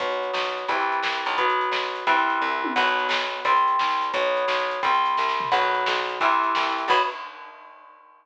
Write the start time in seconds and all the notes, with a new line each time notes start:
0.00 B1 F#3 B3, kick, closed hi-hat
0.12 closed hi-hat
0.23 closed hi-hat
0.33 B1, snare
0.46 closed hi-hat
0.58 closed hi-hat
0.68 C2 E3 G3 C4, kick, closed hi-hat
0.80 closed hi-hat
0.92 closed hi-hat
1.03 C2, snare
1.15 closed hi-hat
1.26 B1, closed hi-hat
1.38 F#3 B3, kick, closed hi-hat
1.50 closed hi-hat
1.61 closed hi-hat
1.72 B1, snare
1.84 closed hi-hat
1.95 closed hi-hat
2.07 C2 E3 G3 C4, kick, closed hi-hat
2.18 closed hi-hat
2.30 closed hi-hat
2.42 C2, kick
2.64 high tom
2.76 B1 F#3 B3, kick, crash
2.87 closed hi-hat
2.99 closed hi-hat
3.09 B1, snare
3.22 closed hi-hat
3.45 C2 G3 C4, kick, closed hi-hat
3.56 closed hi-hat
3.68 closed hi-hat
3.79 C2, snare
3.91 closed hi-hat
4.02 closed hi-hat
4.14 B1 F#3 B3, kick, closed hi-hat
4.25 closed hi-hat
4.37 closed hi-hat
4.48 B1, snare
4.60 closed hi-hat
4.71 closed hi-hat
4.83 C2 G3 C4, kick, closed hi-hat
4.94 closed hi-hat
5.06 closed hi-hat
5.17 C2, kick, snare
5.29 snare
5.40 floor tom
5.52 B1 F#3 B3, kick, crash
5.63 closed hi-hat
5.75 closed hi-hat
5.86 B1, snare
5.98 closed hi-hat
6.09 closed hi-hat
6.21 C2 E3 G3 C4, kick, closed hi-hat
6.32 closed hi-hat
6.44 closed hi-hat
6.55 C2, snare
6.67 closed hi-hat
6.78 closed hi-hat
6.88 B1 F#3 B3, kick, crash